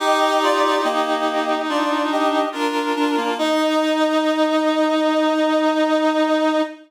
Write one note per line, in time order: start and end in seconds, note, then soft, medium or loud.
0.00 2.43 D#4 loud
0.00 0.81 D#4 loud
0.00 0.39 G4 medium
0.00 0.81 G4 loud
0.00 0.39 D#5 loud
0.42 0.62 F4 loud
0.42 0.62 D5 loud
0.64 0.84 F4 medium
0.64 0.84 D5 medium
0.83 1.54 A#3 medium
0.83 1.61 G4 medium
0.83 1.61 D#5 medium
1.68 2.45 D4 medium
1.68 2.03 F4 medium
1.68 2.03 D5 medium
2.12 2.48 G4 medium
2.12 2.48 D#5 medium
2.52 3.35 D4 medium
2.52 2.93 D4 medium
2.52 3.34 F4 medium
2.52 3.35 A#4 medium
2.96 3.16 D4 loud
3.17 3.37 A#3 medium
3.38 6.62 D#4 loud
3.38 6.62 D#5 loud